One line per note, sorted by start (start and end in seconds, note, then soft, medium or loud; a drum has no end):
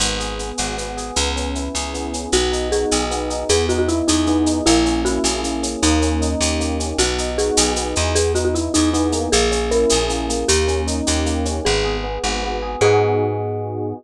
0.00 0.52 G#1 loud
0.00 0.39 B3 medium
0.00 shaker loud
0.19 0.97 G#4 medium
0.19 shaker medium
0.39 0.77 B3 medium
0.39 shaker medium
0.58 1.11 G#1 medium
0.58 1.13 F#4 medium
0.58 shaker medium
0.78 1.14 B3 medium
0.78 shaker medium
0.97 1.16 G#4 medium
0.97 shaker medium
1.16 1.69 C#2 loud
1.16 1.94 B3 medium
1.16 shaker loud
1.36 2.13 C#4 medium
1.36 shaker medium
1.55 2.29 E4 medium
1.55 shaker medium
1.75 2.27 C#2 medium
1.75 2.30 G#4 medium
1.75 shaker medium
1.94 2.31 B3 medium
1.94 shaker medium
2.13 2.32 C#4 medium
2.13 shaker medium
2.32 2.85 B1 loud
2.32 3.10 B3 medium
2.32 2.69 F#4 medium
2.32 shaker loud
2.52 3.30 D#4 medium
2.52 shaker medium
2.72 3.46 F#4 medium
2.72 3.03 G#4 medium
2.72 shaker medium
2.91 3.44 B1 medium
2.91 3.47 G#4 medium
2.91 shaker loud
3.11 3.48 B3 medium
3.11 shaker medium
3.30 3.48 D#4 medium
3.30 shaker medium
3.49 4.02 E2 loud
3.49 4.27 B3 loud
3.49 3.66 G#4 medium
3.49 shaker loud
3.69 4.46 D#4 medium
3.69 3.78 F#4 medium
3.69 shaker medium
3.79 3.88 F#4 medium
3.88 4.07 E4 medium
3.88 4.62 E4 medium
3.88 shaker medium
4.08 4.61 E2 medium
4.08 4.25 D#4 medium
4.08 4.63 G#4 medium
4.08 shaker loud
4.27 4.64 B3 medium
4.27 4.60 D#4 medium
4.27 shaker medium
4.46 4.65 D#4 medium
4.46 shaker medium
4.66 5.19 A#1 loud
4.66 5.43 A#3 loud
4.66 5.02 E4 medium
4.66 shaker loud
4.85 5.62 C#4 medium
4.85 shaker medium
5.05 5.79 E4 medium
5.05 5.41 F#4 medium
5.05 shaker medium
5.24 5.76 A#1 medium
5.24 5.80 G#4 medium
5.24 shaker loud
5.44 5.80 A#3 medium
5.44 shaker medium
5.63 5.81 C#4 medium
5.63 shaker medium
5.82 6.35 D#2 loud
5.82 6.59 A#3 loud
5.82 6.31 D#4 medium
5.82 shaker loud
6.02 6.79 C#4 medium
6.02 shaker medium
6.22 6.95 D#4 medium
6.22 shaker medium
6.41 6.93 D#2 medium
6.41 6.96 G4 medium
6.41 shaker loud
6.60 6.97 A#3 medium
6.60 shaker medium
6.80 6.98 C#4 medium
6.80 shaker medium
6.98 7.51 B1 loud
6.98 7.76 B3 loud
6.98 7.31 F#4 medium
6.98 shaker loud
7.18 7.96 D#4 medium
7.18 shaker medium
7.38 8.12 F#4 medium
7.38 7.73 G#4 medium
7.38 shaker medium
7.57 7.94 B1 loud
7.57 8.13 G#4 medium
7.57 shaker loud
7.76 8.14 B3 medium
7.76 shaker medium
7.96 8.69 E2 loud
7.96 8.15 D#4 medium
7.96 shaker medium
8.15 8.93 B3 medium
8.15 8.33 G#4 medium
8.15 shaker loud
8.35 9.27 D#4 medium
8.35 8.44 F#4 medium
8.35 shaker medium
8.45 8.54 F#4 medium
8.54 8.73 E4 medium
8.54 9.28 E4 medium
8.54 shaker medium
8.74 9.28 E2 medium
8.74 8.90 D#4 medium
8.74 9.29 G#4 medium
8.74 shaker loud
8.93 9.30 B3 loud
8.93 9.29 D#4 medium
8.93 shaker medium
9.12 10.09 A#3 loud
9.12 shaker medium
9.32 9.86 A#1 loud
9.32 9.70 G#4 medium
9.32 shaker loud
9.51 10.44 C#4 medium
9.51 shaker medium
9.71 10.45 E4 medium
9.71 10.05 A#4 medium
9.71 shaker medium
9.89 10.44 A#1 medium
9.89 10.46 G#4 medium
9.89 shaker loud
10.09 10.29 A#3 medium
10.09 shaker medium
10.29 11.26 A#3 loud
10.29 shaker medium
10.48 11.01 D#2 loud
10.48 10.82 G4 medium
10.48 shaker loud
10.68 11.45 C#4 medium
10.68 shaker medium
10.87 11.61 D#4 medium
10.87 shaker medium
11.07 11.60 D#2 medium
11.07 11.62 G4 medium
11.07 shaker loud
11.26 11.63 A#3 loud
11.26 shaker medium
11.45 11.64 C#4 medium
11.45 shaker medium
11.65 12.19 G#1 loud
11.65 12.03 B3 loud
11.65 11.97 G#4 medium
11.84 12.62 G#4 medium
12.04 12.42 B3 medium
12.23 12.76 G#1 medium
12.23 12.79 F#4 medium
12.43 12.80 B3 loud
12.62 12.81 G#4 medium
12.81 13.93 G#2 loud
12.81 13.94 B3 loud
12.81 13.94 D#4 medium
12.81 13.94 F#4 loud
12.81 13.94 G#4 loud